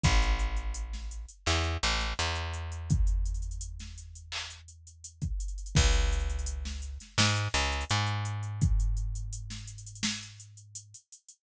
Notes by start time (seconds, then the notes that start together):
0.03 A1, kick, closed hi-hat
0.22 closed hi-hat
0.39 closed hi-hat
0.56 closed hi-hat
0.74 closed hi-hat
0.93 snare, closed hi-hat
1.11 closed hi-hat
1.29 closed hi-hat
1.46 E2, clap
1.63 closed hi-hat
1.83 A1, closed hi-hat
2.00 snare, closed hi-hat
2.19 E2, closed hi-hat
2.35 closed hi-hat
2.53 closed hi-hat
2.72 closed hi-hat
2.90 kick, closed hi-hat
3.07 closed hi-hat
3.25 closed hi-hat
3.34 closed hi-hat
3.42 closed hi-hat
3.51 closed hi-hat
3.61 closed hi-hat
3.79 snare, closed hi-hat
3.98 closed hi-hat
4.15 closed hi-hat
4.32 clap
4.50 closed hi-hat
4.68 closed hi-hat
4.87 closed hi-hat
5.04 closed hi-hat
5.22 kick, closed hi-hat
5.40 closed hi-hat
5.48 closed hi-hat
5.58 closed hi-hat
5.66 closed hi-hat
5.75 C#2, kick, crash
5.93 closed hi-hat
6.13 closed hi-hat
6.20 closed hi-hat
6.30 closed hi-hat
6.39 closed hi-hat
6.46 closed hi-hat
6.65 snare
6.82 closed hi-hat
7.00 snare, closed hi-hat
7.18 G#2, snare
7.36 closed hi-hat
7.54 C#2, closed hi-hat
7.64 closed hi-hat
7.72 closed hi-hat
7.81 closed hi-hat
7.90 G#2, closed hi-hat
8.07 closed hi-hat
8.25 closed hi-hat
8.43 closed hi-hat
8.61 kick, closed hi-hat
8.80 closed hi-hat
8.97 closed hi-hat
9.15 closed hi-hat
9.33 closed hi-hat
9.50 snare, closed hi-hat
9.67 closed hi-hat
9.78 closed hi-hat
9.86 closed hi-hat
9.95 closed hi-hat
10.03 snare
10.22 closed hi-hat
10.40 closed hi-hat
10.57 closed hi-hat
10.75 closed hi-hat
10.94 closed hi-hat
11.12 closed hi-hat
11.29 closed hi-hat